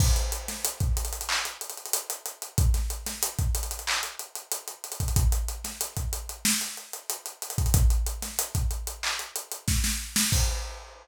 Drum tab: CC |x-------------------------------|--------------------------------|--------------------------------|--------------------------------|
HH |--x-x-x-x-x-xxxx--x-xxxxx-x-x-x-|x-x-x-x-x-x-xxxx--x-x-x-x-x-xxxx|x-x-x-x-x-x-x-x---x-x-x-x-x-xxxx|x-x-x-x-x-x-x-x---x-x-x---------|
CP |----------------x---------------|----------------x---------------|--------------------------------|----------------x---------------|
SD |------o-------------------------|--o---o-------------------------|------o---------o---------------|------o-----------------o-o---o-|
BD |o---------o---------------------|o---------o-------------------o-|o---------o-------------------o-|o---------o-------------o-------|

CC |x-------------------------------|
HH |--------------------------------|
CP |--------------------------------|
SD |--------------------------------|
BD |o-------------------------------|